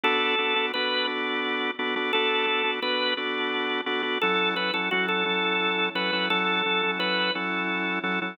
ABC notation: X:1
M:12/8
L:1/8
Q:3/8=115
K:F#m
V:1 name="Drawbar Organ"
A4 B2 z6 | A4 B2 z6 | A2 B A F A5 B2 | A4 B2 z6 |]
V:2 name="Drawbar Organ"
[B,DFA]2 [B,DFA] [B,DFA] [B,DFA]2 [B,DFA]4 [B,DFA] [B,DFA] | [B,DFA]2 [B,DFA] [B,DFA] [B,DFA]2 [B,DFA]4 [B,DFA] [B,DFA] | [F,CEA]2 [F,CEA] [F,CEA] [F,CEA]2 [F,CEA]4 [F,CEA] [F,CEA] | [F,CEA]2 [F,CEA] [F,CEA] [F,CEA]2 [F,CEA]4 [F,CEA] [F,CEA] |]